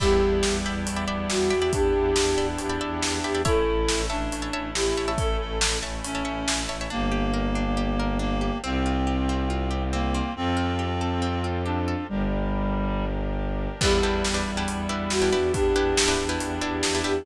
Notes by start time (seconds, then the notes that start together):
0.00 E2 G3 B3 D4 E4 G4 D5 E5 G5 B5, kick, crash
0.21 E2
0.43 E2, snare
0.65 E2 D5 E5 G5 B5
0.86 E2, closed hi-hat
0.96 D5 E5 G5 B5
1.07 E2 D5 E5 G5 B5
1.29 E2 F#4, snare
1.50 E2 D5 E5 G5 B5
1.62 D5 E5 G5 B5
1.73 E2 D4 G4, kick, closed hi-hat
1.94 E2
2.16 E2, snare
2.37 E2 D5 E5 G5 B5
2.58 E2 G4, closed hi-hat
2.70 D5 E5 G5 B5
2.81 E2 D5 E5 G5 B5
3.01 E2, snare
3.24 E2 G4 D5 E5 G5 B5
3.35 D5 E5 G5 B5
3.45 A1 A3 C#4 E4 A4 C#5 E5 A5, kick, closed hi-hat
3.67 A1
3.88 A1, snare
4.10 A1 D4 C#5 E5 A5
4.32 A1, closed hi-hat
4.42 C#5 E5 A5
4.53 A1 C#5 E5 A5
4.75 A1 E4 G4, snare
4.97 A1 C#5 E5 A5
5.08 C#5 E5 A5
5.18 A1 A4, kick, closed hi-hat
5.40 A1 A4
5.61 A1, snare
5.83 A1 C#5 E5 A5
6.04 A1 C#4, closed hi-hat
6.15 C#5 E5 A5
6.25 A1 C#5 E5 A5
6.48 A1, snare
6.69 A1 C#5 E5 A5
6.81 C#5 E5 A5
6.90 G1 A#3 D4 G4
7.12 G4
7.34 A#4
7.55 D4
7.77 G4
8.00 A#4
8.19 A#3 D4
8.41 G4
8.63 C2 C4 F4 G4
8.86 F4
9.07 G4
9.29 C4
9.50 F4
9.71 G4
9.93 A#3 C4
10.14 C4
10.35 F2 C4 F4 G4 A4
10.57 F4
10.79 G4
11.01 A4
11.22 C4
11.44 F4
11.66 D4 G4
11.88 A4
12.09 G1 G3 D4 G4 A#4
13.81 E2 G3 B3 D4 E4 G4 B4, kick, crash
14.03 E2 D4 E4 G4 B4
14.24 E2, snare
14.34 D4 E4 G4 B4
14.47 E2
14.57 D4 E4 G4 B4
14.68 E2, closed hi-hat
14.89 E2 D4 E4 G4 B4
15.10 E2 F#4, snare
15.22 D4 E4 G4 B4
15.32 E2 D4 E4 G4 B4
15.53 E2 D4 G4, kick, closed hi-hat
15.75 E2 D4 E4 G4 B4
15.97 E2, snare
16.08 D4 E4 G4 B4
16.19 E2
16.29 D4 E4 G4 B4
16.40 E2 G4, closed hi-hat
16.61 E2 D4 E4 G4 B4
16.83 E2, snare
16.95 D4 E4 G4 B4
17.04 E2 D4 E4 G4 B4